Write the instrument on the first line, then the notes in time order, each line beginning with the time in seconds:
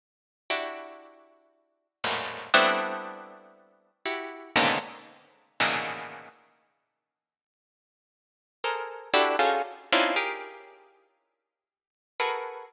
harpsichord
0.50 D4 E4 F#4 G4
2.04 E2 F#2 G#2 A2 A#2
2.54 G3 A3 B3 C4 D4 E4
4.06 E4 F#4 G4
4.56 G#2 A#2 B2 C#3 D3 D#3
5.60 A2 A#2 B2 C#3 D#3 E3
8.64 G#4 A4 A#4 C5
9.14 D4 E4 F#4 G4 A4
9.39 C#4 D#4 F4 F#4 G#4 A4
9.92 C4 C#4 D4 D#4 E4 F4
10.16 G4 G#4 A#4
12.20 F#4 G#4 A4 A#4 B4